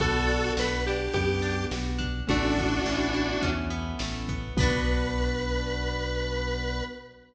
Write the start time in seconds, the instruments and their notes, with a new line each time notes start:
0.00 synth bass 1 B1, acoustic guitar (steel) B3, acoustic grand piano B3 D4 F#4, lead 1 (square) F#4 A4, kick, closed hi-hat
0.28 acoustic guitar (steel) D4, closed hi-hat
0.57 synth bass 1 B1, acoustic guitar (steel) F#4, lead 1 (square) B4, snare
0.86 acoustic guitar (steel) D4, lead 1 (square) G4, closed hi-hat
1.13 synth bass 1 F#2, acoustic guitar (steel) B3, lead 1 (square) G4, kick, closed hi-hat
1.42 acoustic guitar (steel) D4, closed hi-hat
1.71 synth bass 1 B1, acoustic guitar (steel) F#4, snare
1.98 acoustic guitar (steel) D4, kick, closed hi-hat
2.27 synth bass 1 A1, acoustic grand piano A3 B3 C#4 E4, acoustic guitar (steel) A3, lead 1 (square) D4 F#4, kick, closed hi-hat
2.57 acoustic guitar (steel) B3, kick, closed hi-hat
2.85 synth bass 1 A1, acoustic guitar (steel) C#4, snare
3.14 acoustic guitar (steel) E4, closed hi-hat
3.42 synth bass 1 E2, acoustic guitar (steel) C#4, kick, closed hi-hat
3.70 acoustic guitar (steel) B3, closed hi-hat
3.99 synth bass 1 A1, acoustic guitar (steel) A3, snare
4.28 acoustic guitar (steel) B3, kick, closed hi-hat
4.57 synth bass 1 B1, acoustic grand piano B3 D4 F#4, acoustic guitar (steel) B3 D4, lead 1 (square) B4, kick, crash
4.63 acoustic guitar (steel) F#4